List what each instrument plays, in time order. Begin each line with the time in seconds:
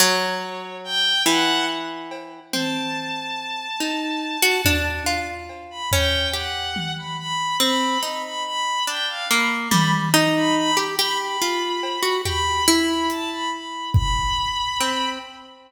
0.00 orchestral harp F#3, violin C#5
0.84 violin G5
1.26 orchestral harp E3, violin F#5
2.11 cowbell
2.53 orchestral harp C4, violin A5, high tom
3.80 orchestral harp D#4
4.42 orchestral harp F#4
4.65 orchestral harp D4, floor tom
5.06 orchestral harp F4
5.49 cowbell
5.70 violin B5
5.92 orchestral harp C#4, violin G5, floor tom
6.33 orchestral harp G4, violin F#5
6.76 high tom
6.97 violin B5
7.18 violin B5
7.60 orchestral harp C4, violin B5
8.02 orchestral harp D#4, violin B5
8.24 violin B5
8.45 violin B5
8.87 orchestral harp D4, violin G5
9.08 violin F5
9.29 orchestral harp A#3, violin B5
9.71 orchestral harp G3, violin B5, high tom
10.14 orchestral harp D#4, violin A#5
10.36 violin B5
10.57 violin B5
10.77 orchestral harp G4
10.99 orchestral harp G4, violin B5
11.20 violin B5
11.42 orchestral harp F4
11.83 cowbell
12.03 orchestral harp F#4
12.25 orchestral harp G4, violin B5, floor tom
12.67 orchestral harp E4, violin B5
13.10 violin A5, closed hi-hat
13.31 violin B5
13.52 violin B5
13.94 violin B5, kick
14.80 orchestral harp C4